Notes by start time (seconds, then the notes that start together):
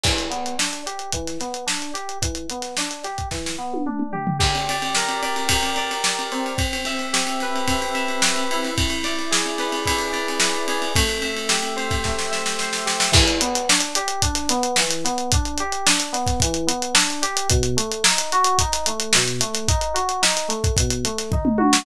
0.03 E3, kick, crash
0.18 closed hi-hat
0.30 B3, closed hi-hat
0.46 closed hi-hat
0.58 D4, snare
0.72 snare, closed hi-hat
0.86 G4, closed hi-hat
0.99 closed hi-hat
1.12 E3, kick, closed hi-hat
1.27 snare, closed hi-hat
1.40 B3, snare, closed hi-hat
1.54 closed hi-hat
1.66 D4, snare
1.82 closed hi-hat
1.94 G4, closed hi-hat
2.09 closed hi-hat
2.22 E3, kick, closed hi-hat
2.35 closed hi-hat
2.50 B3, closed hi-hat
2.62 snare, closed hi-hat
2.77 D4, snare
2.91 closed hi-hat
3.03 G4, snare, closed hi-hat
3.18 kick, closed hi-hat
3.31 E3, kick, snare
3.46 snare
3.58 B3
3.74 high tom
3.86 D4, mid tom
3.99 mid tom
4.13 G4, floor tom
4.27 floor tom
4.39 G4, kick, crash
4.55 ride
4.69 D5, ride
4.82 ride
4.95 A#4, snare
5.09 snare, ride
5.22 D5, ride
5.36 ride
5.49 G4, kick, ride
5.63 ride
5.76 D5, ride
5.91 ride
6.04 D5, snare
6.17 snare, ride
6.32 C4, ride
6.46 ride
6.58 kick, ride
6.73 ride
6.85 E5, ride
6.99 ride
7.13 G4, snare
7.27 ride
7.40 B4, snare, ride
7.56 ride
7.67 C4, kick, ride
7.81 snare, ride
7.94 E5, ride
8.08 ride
8.22 B4, snare
8.36 ride
8.51 E4, ride
8.63 snare, ride
8.78 kick, ride
8.90 ride
9.03 D5, snare, ride
9.19 ride
9.31 G#4, snare
9.46 ride
9.58 B4, snare, ride
9.72 ride
9.86 E4, kick, ride
9.99 ride
10.12 D5, ride
10.28 ride
10.40 B4, snare
10.55 ride
10.68 G#4, ride
10.82 ride
10.95 A3, kick, ride
11.09 ride
11.21 E5, ride
11.36 ride
11.49 G4, snare
11.63 snare, ride
11.76 C5, ride
11.90 kick, snare, ride
12.04 A3, kick, snare
12.19 snare
12.31 E5, snare
12.46 snare
12.59 C5, snare
12.73 snare
12.85 G4, snare
13.00 snare
13.12 E3, kick, crash
13.28 closed hi-hat
13.41 B3, closed hi-hat
13.55 snare, closed hi-hat
13.69 D4, snare
13.80 snare, closed hi-hat
13.95 G4, closed hi-hat
14.08 closed hi-hat
14.22 D4, kick, closed hi-hat
14.35 snare, closed hi-hat
14.49 B3, snare, closed hi-hat
14.63 closed hi-hat
14.76 E3, snare
14.91 closed hi-hat
15.04 B3, snare, closed hi-hat
15.18 closed hi-hat
15.32 D4, kick, closed hi-hat
15.45 closed hi-hat
15.58 G4, closed hi-hat
15.72 closed hi-hat
15.86 D4, snare
16.00 closed hi-hat
16.13 B3, snare, closed hi-hat
16.26 kick, snare, closed hi-hat
16.40 E3, kick, closed hi-hat
16.54 closed hi-hat
16.67 B3, closed hi-hat
16.82 closed hi-hat
16.94 D4, snare
17.09 snare, closed hi-hat
17.22 G4, snare, closed hi-hat
17.37 closed hi-hat
17.49 B2, kick, closed hi-hat
17.63 closed hi-hat
17.77 A3, closed hi-hat
17.91 closed hi-hat
18.04 D#4, snare
18.18 closed hi-hat
18.32 F#4, closed hi-hat
18.44 closed hi-hat
18.59 D#4, kick, closed hi-hat
18.72 snare, closed hi-hat
18.86 A3, closed hi-hat
19.00 closed hi-hat
19.13 B2, snare
19.27 snare, closed hi-hat
19.39 A3, snare, closed hi-hat
19.54 snare, closed hi-hat
19.68 D#4, kick, closed hi-hat
19.81 closed hi-hat
19.94 F#4, closed hi-hat
20.09 closed hi-hat
20.22 D#4, snare
20.37 closed hi-hat
20.48 A3, closed hi-hat
20.64 kick, closed hi-hat
20.76 B2, kick, closed hi-hat
20.90 closed hi-hat
21.05 A3, closed hi-hat
21.18 snare, closed hi-hat
21.31 D#4, kick, floor tom
21.45 mid tom
21.58 F#4, high tom
21.73 snare